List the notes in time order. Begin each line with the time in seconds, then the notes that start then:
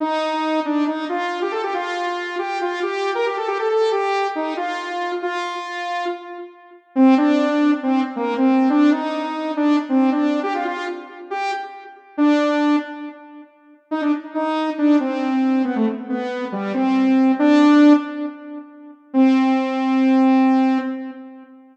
0.00 D#4
0.65 D4
0.87 D#4
1.09 F4
1.42 G4
1.52 A4
1.63 G4
1.74 F4
2.38 G4
2.61 F4
2.82 G4
3.15 A#4
3.26 G4
3.37 A4
3.47 G4
3.59 A4
3.69 A4
3.91 G4
4.35 D#4
4.57 F4
5.22 F4
6.95 C4
7.17 D4
7.83 C4
8.16 A#3
8.37 C4
8.69 D4
8.91 D#4
9.56 D4
9.89 C4
10.12 D4
10.43 G4
10.54 F4
10.65 F4
11.30 G4
12.17 D4
13.91 D#4
14.02 D4
14.34 D#4
14.78 D4
15.00 C4
15.64 B3
15.76 A3
16.09 B3
16.52 G3
16.74 C4
17.39 D4
19.13 C4